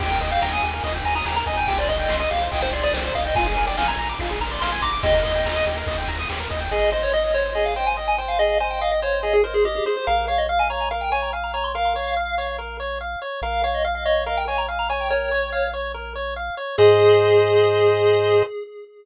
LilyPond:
<<
  \new Staff \with { instrumentName = "Lead 1 (square)" } { \time 4/4 \key ees \major \tempo 4 = 143 g''8. f''16 g''16 aes''8. r8 aes''16 bes''16 bes''16 bes''16 aes''8 | g''16 d''16 ees''8. ees''16 f''8 g''16 c''16 d''16 d''16 c''8 f''16 ees''16 | aes''8. g''16 aes''16 bes''8. r8 bes''16 c'''16 c'''16 c'''16 d'''8 | ees''2 r2 |
\key aes \major ees''8 ees''16 des''16 ees''16 ees''16 des''8 ees''16 f''16 g''16 aes''16 r16 aes''16 g''16 f''16 | ees''8 aes''16 g''16 f''16 ees''16 des''8 ees''16 aes'16 bes'16 aes'16 g'16 g'16 aes'16 c''16 | f''8 f''16 ees''16 f''16 aes''16 bes''8 f''16 g''16 aes''16 bes''16 r16 bes''16 bes''16 c'''16 | f''2 r2 |
f''8 f''16 ees''16 f''16 f''16 ees''8 f''16 g''16 aes''16 bes''16 r16 bes''16 aes''16 g''16 | des''4. r2 r8 | aes'1 | }
  \new Staff \with { instrumentName = "Lead 1 (square)" } { \time 4/4 \key ees \major g'16 bes'16 ees''16 g''16 bes''16 ees'''16 g'16 bes'16 ees''16 g''16 bes''16 ees'''16 g'16 bes'16 ees''16 g''16 | g'16 c''16 ees''16 g''16 c'''16 ees'''16 g'16 c''16 ees''16 g''16 c'''16 ees'''16 g'16 c''16 ees''16 g''16 | f'16 aes'16 bes'16 d''16 f''16 aes''16 bes''16 d'''16 f'16 aes'16 bes'16 d''16 f''16 aes''16 bes''16 d'''16 | g'16 bes'16 ees''16 g''16 bes''16 ees'''16 g'16 bes'16 ees''16 g''16 bes''16 ees'''16 g'16 bes'16 ees''16 g''16 |
\key aes \major aes'8 c''8 ees''8 c''8 aes'8 c''8 ees''8 c''8 | aes'8 c''8 ees''8 c''8 aes'8 c''8 ees''8 c''8 | bes'8 des''8 f''8 des''8 bes'8 des''8 f''8 des''8 | bes'8 des''8 f''8 des''8 bes'8 des''8 f''8 des''8 |
bes'8 des''8 f''8 des''8 bes'8 des''8 f''8 des''8 | bes'8 des''8 f''8 des''8 bes'8 des''8 f''8 des''8 | <aes' c'' ees''>1 | }
  \new Staff \with { instrumentName = "Synth Bass 1" } { \clef bass \time 4/4 \key ees \major ees,8 ees,8 ees,8 ees,8 ees,8 ees,8 ees,8 ees,8 | c,8 c,8 c,8 c,8 c,8 c,8 c,8 c,8 | bes,,8 bes,,8 bes,,8 bes,,8 bes,,8 bes,,8 bes,,8 bes,,8 | ees,8 ees,8 ees,8 ees,8 ees,8 ees,8 ees,8 ees,8 |
\key aes \major aes,,1~ | aes,,1 | bes,,1~ | bes,,1 |
bes,,1~ | bes,,1 | aes,1 | }
  \new DrumStaff \with { instrumentName = "Drums" } \drummode { \time 4/4 <cymc bd>8 <bd cymr>8 sn8 cymr8 <bd cymr>8 cymr8 sn8 <bd cymr>8 | <bd cymr>8 <bd cymr>8 sn8 cymr8 <bd cymr>8 cymr8 sn8 <bd cymr>8 | <bd cymr>8 <bd cymr>8 sn8 cymr8 <bd cymr>8 cymr8 sn8 <bd cymr>8 | <bd cymr>8 <bd cymr>8 sn8 cymr8 <bd cymr>8 cymr8 sn8 <bd cymr>8 |
r4 r4 r4 r4 | r4 r4 r4 r4 | r4 r4 r4 r4 | r4 r4 r4 r4 |
r4 r4 r4 r4 | r4 r4 r4 r4 | r4 r4 r4 r4 | }
>>